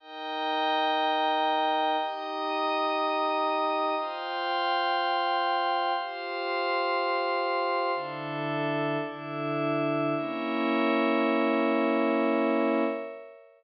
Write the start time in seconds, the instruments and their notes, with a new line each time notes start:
0.00 pad 2 (warm) D#4 A#4 G5, pad 5 (bowed) D#5 G5 A#5
1.98 pad 2 (warm) D#4 G4 G5, pad 5 (bowed) D#5 A#5 D#6
3.96 pad 2 (warm) F4 C5 G5, pad 5 (bowed) F5 G5 C6
5.95 pad 2 (warm) F4 G4 G5, pad 5 (bowed) C5 F5 C6
7.93 pad 2 (warm) D3 E4 A4, pad 5 (bowed) D4 A4 E5
8.98 pad 2 (warm) D3 D4 A4, pad 5 (bowed) D4 E4 E5
10.16 pad 2 (warm) A#3 C#4 E4, pad 5 (bowed) A#4 C#5 E5